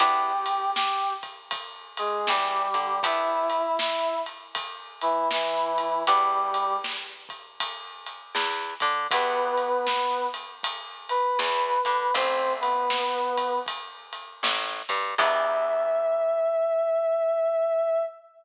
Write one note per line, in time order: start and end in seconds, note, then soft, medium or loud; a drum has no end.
0.00 2.01 E2 medium
0.00 0.33 B3 medium
0.00 0.33 D4 medium
0.00 0.33 E4 medium
0.00 0.70 G4 medium
0.00 0.33 G4 medium
0.00 0.70 G5 medium
0.00 kick loud
0.00 ride loud
0.46 ride medium
0.76 1.13 G4 medium
0.76 1.13 G5 medium
0.76 snare loud
1.23 kick medium
1.23 ride medium
1.51 kick medium
1.51 ride loud
1.97 2.27 G#3 medium
1.97 2.27 G#4 medium
1.97 ride medium
2.27 2.67 E2 medium
2.27 2.68 E3 medium
2.27 3.00 G3 medium
2.27 3.00 G4 medium
2.27 snare loud
2.74 3.00 D3 medium
2.74 2.99 D4 medium
2.74 ride medium
3.03 3.62 B3 medium
3.03 3.62 D4 medium
3.03 3.62 E4 medium
3.03 3.76 E4 medium
3.03 3.62 G4 medium
3.03 3.76 E5 medium
3.03 kick loud
3.03 ride loud
3.50 ride medium
3.79 4.19 E4 medium
3.79 4.19 E5 medium
3.79 snare loud
4.26 ride medium
4.55 kick medium
4.55 ride loud
5.01 5.28 E3 medium
5.01 5.28 E4 medium
5.01 ride medium
5.31 6.03 E3 medium
5.31 6.03 E4 medium
5.31 snare loud
5.78 kick medium
5.78 ride medium
6.07 8.09 E2 loud
6.07 6.77 G3 medium
6.07 6.65 B3 medium
6.07 6.65 D4 medium
6.07 6.65 E4 medium
6.07 6.65 G4 medium
6.07 6.77 G4 medium
6.07 kick loud
6.07 ride loud
6.54 ride medium
6.84 snare loud
7.29 kick medium
7.29 ride medium
7.60 kick medium
7.60 ride loud
8.06 ride medium
8.35 8.74 E2 medium
8.35 8.75 E3 medium
8.35 snare loud
8.80 9.07 D3 medium
8.80 9.07 D4 medium
8.80 kick medium
8.80 ride medium
9.11 11.13 E2 loud
9.11 9.70 B3 medium
9.11 9.86 B3 medium
9.11 9.70 D4 medium
9.11 9.70 E4 medium
9.11 9.70 G4 medium
9.11 9.86 B4 medium
9.11 kick loud
9.11 ride loud
9.57 ride medium
9.87 10.27 B3 medium
9.87 10.27 B4 medium
9.87 snare loud
10.34 ride medium
10.63 kick medium
10.63 ride loud
11.09 11.38 B4 medium
11.09 11.38 B5 medium
11.09 ride medium
11.39 11.78 E2 medium
11.39 11.79 E3 medium
11.39 12.13 B4 medium
11.39 12.13 B5 medium
11.39 snare loud
11.85 12.11 D3 medium
11.85 12.11 D4 medium
11.85 kick medium
11.85 ride medium
12.14 14.16 A1 loud
12.14 12.73 A3 medium
12.14 12.73 C4 medium
12.14 12.53 C4 medium
12.14 12.73 E4 medium
12.14 12.73 G4 medium
12.14 12.53 C5 medium
12.14 kick loud
12.14 ride loud
12.61 13.59 B3 medium
12.61 13.59 B4 medium
12.61 ride medium
12.90 snare loud
13.38 kick medium
13.38 ride medium
13.66 kick medium
13.66 ride medium
14.13 ride medium
14.43 14.82 A1 medium
14.43 14.82 A3 medium
14.43 snare loud
14.89 15.15 G2 medium
14.89 15.15 G3 medium
14.89 kick medium
14.89 ride medium
15.18 18.02 E2 loud
15.18 18.03 B3 loud
15.18 18.03 D4 loud
15.18 18.03 E4 loud
15.18 18.03 G4 medium
15.18 18.03 E5 loud
15.18 kick loud
15.18 crash loud